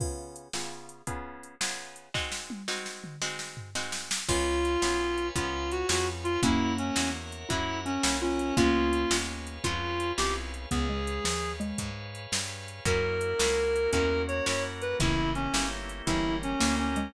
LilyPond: <<
  \new Staff \with { instrumentName = "Clarinet" } { \time 12/8 \key des \major \tempo 4. = 112 r1. | r1. | f'2. f'4 ges'8 ges'8 r8 f'8 | fes'4 des'4 r4 fes'4 des'4 des'4 |
f'2 r4 f'4. g'8 r4 | aes'2~ aes'8 r2. r8 | bes'2. bes'4 des''8 des''8 r8 b'8 | fes'4 des'4 r4 fes'4 des'4 des'4 | }
  \new Staff \with { instrumentName = "Xylophone" } { \time 12/8 \key des \major r1. | r1. | r2. f'2. | <bes des'>2~ <bes des'>8 r8 fes'4 des'4 f'4 |
<bes des'>2. f'2~ f'8 r8 | ces'8 aes4 f4 aes4 r2 r8 | r2. des'2. | <des fes>4. r4. fes4. bes4 aes8 | }
  \new Staff \with { instrumentName = "Acoustic Guitar (steel)" } { \time 12/8 \key des \major <des ces' f' aes'>4. <des ces' f' aes'>4. <des ces' f' aes'>4. <des ces' f' aes'>4. | <aes c' ees' ges'>4. <aes c' ees' ges'>4. <aes c' ees' ges'>4. <aes c' ees' ges'>4. | <ces' des' f' aes'>4. <ces' des' f' aes'>4. <ces' des' f' aes'>4. <ces' des' f' aes'>4. | <bes des' fes' ges'>4. <bes des' fes' ges'>4. <bes des' fes' ges'>4. <bes des' fes' ges'>4. |
<aes ces' des' f'>4. <aes ces' des' f'>4. <aes ces' des' f'>4. <aes ces' des' f'>4. | r1. | <bes des' fes' ges'>4. <bes des' fes' ges'>4. <bes des' fes' ges'>4. <bes des' fes' ges'>4. | <bes des' fes' g'>4. <bes des' fes' g'>4. <bes des' fes' g'>4. <bes des' fes' g'>4. | }
  \new Staff \with { instrumentName = "Electric Bass (finger)" } { \clef bass \time 12/8 \key des \major r1. | r1. | des,4. ces,4. des,4. f,4. | ges,4. fes,4. ges,4. c,4. |
des,4. ees,4. f,4. c,4. | des,4. ees,4. aes,4. g,4. | ges,4. des,4. fes,4. ges,4. | g,,4. g,,4. g,,4. d,4. | }
  \new Staff \with { instrumentName = "Drawbar Organ" } { \time 12/8 \key des \major r1. | r1. | <ces'' des'' f'' aes''>1. | <bes' des'' fes'' ges''>1. |
<aes' ces'' des'' f''>1. | <aes' ces'' des'' f''>1. | <bes des' fes' ges'>2. <bes des' ges' bes'>2. | <bes des' fes' g'>2. <bes des' g' bes'>2. | }
  \new DrumStaff \with { instrumentName = "Drums" } \drummode { \time 12/8 <cymc bd>4 hh8 sn4 hh8 <hh bd>4 hh8 sn4 hh8 | <bd sn>8 sn8 tommh8 sn8 sn8 toml8 sn8 sn8 tomfh8 sn8 sn8 sn8 | <cymc bd>4 hh8 sn4 hh8 <hh bd>4 hh8 sn4 hh8 | <hh bd>4 hh8 sn4 hh8 <hh bd>4 hh8 sn4 hh8 |
<hh bd>4 hh8 sn4 hh8 <hh bd>4 hh8 sn4 hh8 | <hh bd>4 hh8 sn4 hh8 <hh bd>4 hh8 sn4 hh8 | <hh bd>4 hh8 sn4 hh8 <hh bd>4 hh8 sn4 hh8 | <hh bd>4 hh8 sn4 hh8 <hh bd>4 hh8 sn4 hh8 | }
>>